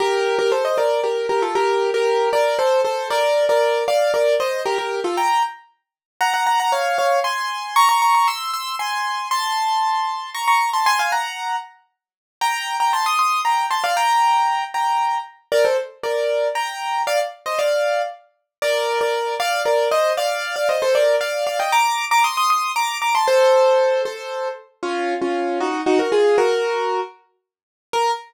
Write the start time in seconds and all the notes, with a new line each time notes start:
0.00 G4 A#4
0.39 G4 A#4
0.52 A4 C5
0.65 C5 D#5
0.78 A#4 D5
1.04 G4 A#4
1.29 G4 A#4
1.42 F4 A4
1.55 G4 A#4
1.94 G4 A#4
2.33 A#4 D5
2.59 A4 C5
2.84 A4 C5
3.10 A#4 D5
3.49 A#4 D5
3.88 D5 F5
4.14 A#4 D5
4.40 C5 D#5
4.66 G4 A#4
4.78 G4 A#4
5.04 F4 A4
5.17 G5 A#5
6.21 F#5 A#5
6.34 F#5 A#5
6.47 F#5 A#5
6.60 F#5 A#5
6.72 C#5 F5
6.98 C#5 F5
7.24 G#5 C6
7.76 A#5 C#6
7.89 A#5 C#6
8.02 A#5 C#6
8.15 A#5 C#6
8.28 C6 E6
8.53 C6 E6
8.79 G#5 C6
9.31 A5 C6
10.34 A#5 C#6
10.48 A#5 C#6
10.73 A5 C6
10.86 G#5 C6
10.99 F5 G#5
11.12 F#5 A#5
12.41 G5 A#5
12.80 G5 A#5
12.93 A5 C6
13.06 C6 D#6
13.19 C6 D#6
13.45 G5 A#5
13.71 A5 C6
13.84 D5 F5
13.97 G5 A#5
14.74 G5 A#5
15.52 A#4 D5
15.65 A4 C5
16.03 A#4 D5
16.55 G5 A#5
17.07 D5 F5
17.46 C5 D#5
17.59 D5 F5
18.62 A#4 D5
19.01 A#4 D5
19.40 D5 F5
19.65 A#4 D5
19.91 C5 D#5
20.17 D5 F5
20.56 D5 F5
20.69 C5 D#5
20.82 A4 C5
20.95 A#4 D5
21.21 D5 F5
21.47 D5 F5
21.59 D#5 G5
21.72 A#5 D6
22.11 A#5 D6
22.24 C6 D#6
22.37 C6 D#6
22.50 C6 D#6
22.76 A#5 D6
23.02 A#5 D6
23.15 A5 C6
23.28 A4 C5
24.05 A4 C5
24.83 C#4 F4
25.22 C#4 F4
25.60 D#4 F#4
25.86 D#4 F#4
25.99 F#4 A#4
26.12 F4 G#4
26.38 F#4 A#4
27.93 A#4